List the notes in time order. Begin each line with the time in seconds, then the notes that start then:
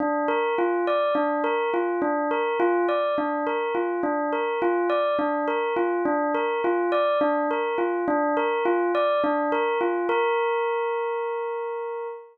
0.00 D4
0.28 A#4
0.58 F4
0.87 D5
1.15 D4
1.44 A#4
1.74 F4
2.02 D4
2.31 A#4
2.60 F4
2.89 D5
3.18 D4
3.47 A#4
3.75 F4
4.03 D4
4.33 A#4
4.62 F4
4.90 D5
5.19 D4
5.48 A#4
5.76 F4
6.05 D4
6.34 A#4
6.64 F4
6.92 D5
7.21 D4
7.51 A#4
7.78 F4
8.08 D4
8.37 A#4
8.65 F4
8.95 D5
9.24 D4
9.52 A#4
9.81 F4
10.09 A#4